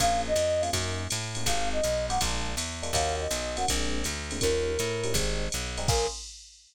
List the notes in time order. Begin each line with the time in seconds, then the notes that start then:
0.00 A#1 A#3 C#4 F4 G#4 F5, kick, ride
0.28 D#5
0.36 F2, hi-hat pedal, ride
0.61 A#3 C#4 F4 G#4 F5, ride
0.73 F#2 A#3 C#4 D#4 F#4, kick, ride
1.10 A2, hi-hat pedal, ride
1.35 A#3 C#4 D#4 F#4, ride
1.46 G#1 G#3 C4 D#4 G4 F5, kick, ride
1.72 D#5
1.83 B1, hi-hat pedal, ride
2.09 G#3 C4 D#4 G4 F#5, ride
2.21 A#1 G#3 A#3 D4 F4, kick, ride
2.57 E2, hi-hat pedal, ride
2.83 G#3 A#3 D4 F4, ride
2.93 D#2 A#3 C#4 D#4 F#4 F5, kick, ride
3.21 D#5
3.31 B1, hi-hat pedal, ride
3.56 A#3 C#4 D#4 F#4 F#5, ride
3.68 A#1 G#3 A#3 C4 D4, kick, ride
4.04 D2, hi-hat pedal, ride
4.31 G#3 A#3 C4 D4, ride
4.41 D#2 F3 G3 C#4 D#4 A#4, kick, ride
4.79 A2, hi-hat pedal, ride
5.04 F3 G3 C#4 D#4, ride
5.14 G#1 G3 G#3 C4 D#4, kick, ride
5.52 B1, hi-hat pedal, ride
5.78 G3 G#3 C4 D#4, ride
5.88 A#1 A#3 C#4 F4 G#4 A#4, kick, crash